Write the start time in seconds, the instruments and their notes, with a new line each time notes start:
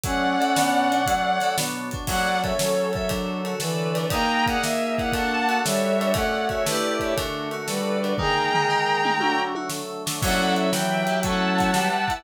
0.03 drawbar organ F#3 A3 C#4, electric piano 2 F#3, brass section C#4, violin D5 F#5, kick, closed hi-hat
0.40 electric piano 2 A4, closed hi-hat
0.56 drawbar organ B2 F#3 D4, electric piano 2 B3, snare
0.90 electric piano 2 D4, closed hi-hat
1.06 drawbar organ F#3 A3 C#4, electric piano 2 F#3, kick, closed hi-hat
1.40 electric piano 2 A4, snare, closed hi-hat
1.57 drawbar organ B2 F#3 D4, electric piano 2 B3, snare
1.91 electric piano 2 D4, kick, closed hi-hat
2.07 brass section F#3, electric piano 2 F#3, drawbar organ F#3 C#4 A4, violin D5 F#5, kick, crash
2.43 electric piano 2 A4, violin C#5 E5, kick, ride
2.57 brass section F#3, violin A4 C#5, electric piano 2 A4, snare
2.93 electric piano 2 A4, violin C#5 E5, kick, ride
3.09 drawbar organ D3 F#3 A4, electric piano 2 D4, kick, ride
3.45 electric piano 2 F#4, ride
3.60 brass section E3, electric piano 2 A4, violin B4 D5, snare
3.95 electric piano 2 D4, snare, ride
4.10 brass section A#3, electric piano 2 D#4, drawbar organ D#4 G#4 A#4, violin G5 A#5, kick, ride
4.46 electric piano 2 G#4, violin D5 F#5, kick, ride
4.61 brass section A#3, electric piano 2 A#4, violin E5, snare
4.98 electric piano 2 E4, violin D5 F#5, kick, ride
5.12 drawbar organ D4 F#4 A4, electric piano 2 D4, violin F#5 A5, kick, ride
5.49 electric piano 2 F#4, ride
5.64 brass section G3, electric piano 2 A4, violin C#5 E5, snare
6.00 electric piano 2 D4, ride
6.14 drawbar organ A3 C#4 F#4, brass section A3, electric piano 2 A3, violin D5 F#5, kick, ride
6.49 electric piano 2 F#4, violin C#5 E5, kick, ride
6.66 drawbar organ A3 D4 E4 G4, brass section A3, electric piano 2 A3 E4, violin B4 D5, snare
6.72 electric piano 2 G4 D5
7.00 violin C#5 E5, kick, ride
7.16 drawbar organ D3 A3 F#4, electric piano 2 D4, kick, ride
7.51 electric piano 2 F#4, ride
7.67 brass section G3, electric piano 2 A4, violin B4 D5, snare
8.03 electric piano 2 D4, ride
8.18 drawbar organ D#3 G#3 A#3, electric piano 2 D#4, brass section G#4, violin G5 A#5, kick, floor tom
8.54 electric piano 2 G#4, floor tom
8.69 electric piano 2 A#4
9.04 electric piano 2 D#4, mid tom
9.20 drawbar organ D3 F#3 A3, electric piano 2 D4, brass section F#4, high tom
9.55 electric piano 2 F#4, high tom
9.69 electric piano 2 A4, snare
10.06 electric piano 2 D4, snare
10.22 brass section F#3, electric piano 2 F#3 C#4, drawbar organ F#4 A4 C#5 E5, violin D5 F#5, kick, crash
10.27 electric piano 2 E4 A4
10.56 violin C#5 E5, closed hi-hat
10.72 electric piano 2 E3, drawbar organ E4 G4 B4, violin E5 G5, snare
11.07 electric piano 2 G4, closed hi-hat
11.23 electric piano 2 F#3 A3, drawbar organ F#4 A4 C#5 E5, violin F#5 A5, kick, closed hi-hat
11.29 electric piano 2 C#4 E4
11.58 kick, snare, closed hi-hat
11.74 electric piano 2 G3, drawbar organ G4 B4 E5, snare
12.08 electric piano 2 E4, kick, closed hi-hat